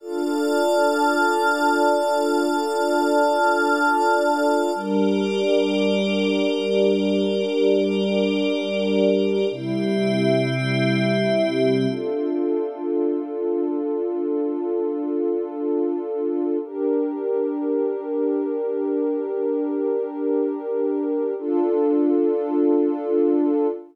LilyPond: <<
  \new Staff \with { instrumentName = "Pad 2 (warm)" } { \time 4/4 \key d \minor \tempo 4 = 101 <d' f' a'>1~ | <d' f' a'>1 | <g d' bes'>1~ | <g d' bes'>1 |
<c g e'>1 | <d' f' a'>1~ | <d' f' a'>1 | <d' g' bes'>1~ |
<d' g' bes'>1 | <d' f' a'>1 | }
  \new Staff \with { instrumentName = "Pad 5 (bowed)" } { \time 4/4 \key d \minor <d'' a'' f'''>1~ | <d'' a'' f'''>1 | <g' bes' d''>1~ | <g' bes' d''>1 |
<c' g' e''>1 | r1 | r1 | r1 |
r1 | r1 | }
>>